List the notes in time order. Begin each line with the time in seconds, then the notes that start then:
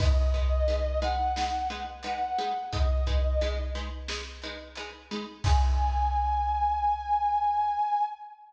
0.00 G#3 D#4 B4 D#5, kick, crash
0.34 G#3 D#4 B4, kick, closed hi-hat
0.68 G#3 D#4 B4, closed hi-hat
1.02 G#3 D#4 B4 F#5, closed hi-hat
1.36 G#3 D#4 B4, snare
1.70 G#3 D#4 B4, closed hi-hat
2.03 G#3 D#4 B4 F#5, closed hi-hat
2.38 G#3 D#4 B4, closed hi-hat
2.72 G#3 D#4 B4 D#5, kick, closed hi-hat
3.07 G#3 D#4 B4, kick, closed hi-hat
3.41 G#3 D#4 B4, closed hi-hat
3.75 G#3 D#4 B4, closed hi-hat
4.08 G#3 D#4 B4, snare
4.42 G#3 D#4 B4, closed hi-hat
4.75 G#3 D#4 B4, closed hi-hat
5.11 G#3 D#4 B4, closed hi-hat
5.44 G#3 D#4 B4 G#5, kick, crash